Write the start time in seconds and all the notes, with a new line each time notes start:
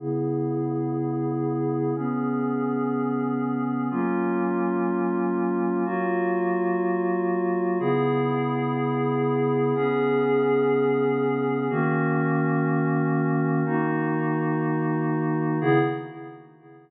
0.00 C#3 B3 E4 G#4
1.96 C#3 B3 C#4 G#4
3.91 F#3 A#3 C#4 F4
5.85 F#3 A#3 F4 F#4
7.80 C#3 B3 E4 G#4
9.75 C#3 B3 C#4 G#4
11.70 D#3 A#3 C#4 F#4
13.66 D#3 A#3 D#4 F#4
15.61 C#3 B3 E4 G#4